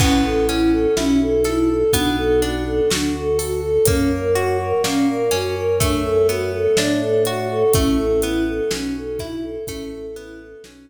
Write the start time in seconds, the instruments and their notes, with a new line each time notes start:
0.00 drawbar organ A1, orchestral harp B3, choir aahs C#4, kick, crash
0.24 choir aahs A4
0.49 orchestral harp C#4, choir aahs E4, closed hi-hat
0.72 choir aahs A4
0.96 drawbar organ B1, choir aahs C#4, orchestral harp E4, snare
1.21 choir aahs A4
1.44 choir aahs E4, orchestral harp A4, snare, closed hi-hat
1.70 choir aahs A4
1.93 drawbar organ B1, orchestral harp B3, choir aahs D4, kick, closed hi-hat
2.17 choir aahs A4
2.42 orchestral harp D4, choir aahs F#4, closed hi-hat
2.66 choir aahs A4
2.91 drawbar organ D2, choir aahs D4, orchestral harp F#4, snare
3.16 choir aahs A4
3.38 choir aahs F#4, orchestral harp A4, open hi-hat
3.64 choir aahs A4
3.85 drawbar organ F#2, orchestral harp A#3, choir aahs C#4, kick, closed hi-hat
4.11 choir aahs A#4
4.35 choir aahs F#4, orchestral harp F#4, closed hi-hat
4.59 choir aahs A#4
4.84 drawbar organ A#2, orchestral harp A#3, choir aahs C#4, snare
5.09 choir aahs A#4
5.31 drawbar organ F#2, orchestral harp C#4, choir aahs F#4, snare, closed hi-hat
5.56 choir aahs A#4
5.80 orchestral harp A3, choir aahs D4, kick, closed hi-hat
6.04 choir aahs A4
6.29 orchestral harp B3, choir aahs F#4, closed hi-hat
6.54 choir aahs A4
6.77 drawbar organ A2, choir aahs D4, orchestral harp D4, snare
7.00 choir aahs A4
7.25 choir aahs F#4, orchestral harp F#4, closed hi-hat
7.50 choir aahs A4
7.73 drawbar organ A1, orchestral harp A3, choir aahs C#4, kick, closed hi-hat
7.98 choir aahs A4
8.22 orchestral harp B3, choir aahs E4, closed hi-hat
8.48 choir aahs A4
8.71 drawbar organ B1, orchestral harp C#4, choir aahs C#4, snare
8.97 choir aahs A4
9.19 orchestral harp E4, choir aahs E4, kick, snare, closed hi-hat
9.42 choir aahs A4
9.67 drawbar organ A1, orchestral harp A3, choir aahs C#4, kick, closed hi-hat
9.94 choir aahs A4
10.16 orchestral harp B3, choir aahs E4, closed hi-hat
10.40 choir aahs A4
10.64 drawbar organ B1, choir aahs C#4, orchestral harp C#4, snare